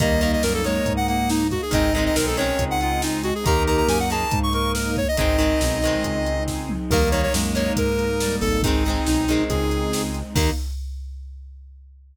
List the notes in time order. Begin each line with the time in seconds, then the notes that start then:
0.00 D#2 D#3 G3 A#3 D#4 D#5, kick, closed hi-hat
0.21 D#3 A#3 D#5, closed hi-hat
0.33 D#5
0.43 F#2 A#4, snare
0.54 A4
0.64 D#3 G#3 A#3 C#5, closed hi-hat
0.86 G#2, kick, closed hi-hat
0.97 F#5
1.08 A#3 F#5, closed hi-hat
1.29 D#4, snare
1.51 F#4, kick, closed hi-hat
1.62 G#4
1.71 G#1 D#3 G#3 C4 D#4 D#5, kick, closed hi-hat
1.94 D#3 G#3 D#5, closed hi-hat
1.98 C4
2.06 D#5
2.16 B1 A#4, snare
2.27 A4
2.37 D#3 G#3 C4 C#4 C#5, closed hi-hat
2.59 C#2, kick, closed hi-hat
2.71 F#5
2.81 F4 F#5, closed hi-hat
3.02 D#4, snare
3.23 F#4, closed hi-hat
3.35 G#4
3.44 D#2 D#3 A#3 D#4 G4 A#4 A#5, kick, closed hi-hat
3.67 D#3 A#3 A#5, closed hi-hat
3.77 A#5
3.88 F#2 G#5, snare
4.00 F#5
4.10 D#3 A#3 G#4 A5, closed hi-hat
4.31 G#2, kick, closed hi-hat
4.43 C#6
4.53 A#4 C#6, closed hi-hat
4.75 A#4, snare
4.96 C#5, kick, closed hi-hat
5.08 D#5
5.17 G#1 D#3 G#3 C4 D#4 D#5, kick, closed hi-hat
5.38 D#3 G#3 C4, closed hi-hat
5.61 B1, snare
5.82 D#3 G#3, closed hi-hat
5.87 C4
6.04 C#2, kick, closed hi-hat
6.26 closed hi-hat
6.47 kick, snare
6.69 mid tom
6.90 D#2 D#3 G3 A#3 D#4 A#4, kick, crash
7.11 D#3 A#3 C#5, closed hi-hat
7.23 C#5
7.34 F#2 G#3, snare
7.55 D#3 A#3 C#5, closed hi-hat
7.76 G#2 A#4, kick, closed hi-hat
7.99 closed hi-hat
8.20 G3, snare
8.41 G#1 A4, kick, open hi-hat
8.63 D#3 G#3 C4 D#4, kick, closed hi-hat
8.67 C4
8.86 D#3 G#3 C4, closed hi-hat
9.06 B1 D#4, snare
9.28 D#3 G#3 C4, closed hi-hat
9.49 C#2 G#4, kick, closed hi-hat
9.71 closed hi-hat
9.93 snare
10.14 closed hi-hat
10.35 D#2 D#3 A#3 D#4, kick, crash